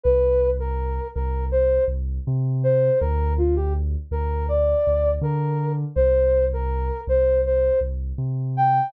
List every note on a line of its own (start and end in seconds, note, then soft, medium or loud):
0.03 0.99 C2 medium
0.03 0.50 B4 loud
0.59 1.07 A#4 medium
1.15 1.79 C2 medium
1.15 1.45 A#4 medium
1.51 1.84 C5 loud
1.88 2.19 C2 medium
2.27 2.90 C3 medium
2.63 2.99 C5 loud
3.00 3.96 D2 loud
3.00 3.33 A#4 loud
3.38 3.55 F4 loud
3.56 3.73 G4 loud
4.11 4.74 D2 medium
4.11 4.46 A#4 loud
4.48 5.11 D5 loud
4.87 5.18 D2 medium
5.21 5.84 D3 medium
5.21 5.72 A#4 loud
5.96 6.91 C2 medium
5.96 6.45 C5 loud
6.53 7.01 A#4 loud
7.07 7.70 C2 medium
7.07 7.41 C5 loud
7.46 7.79 C5 medium
7.81 8.12 C2 medium
8.18 8.81 C3 medium
8.57 8.90 G5 loud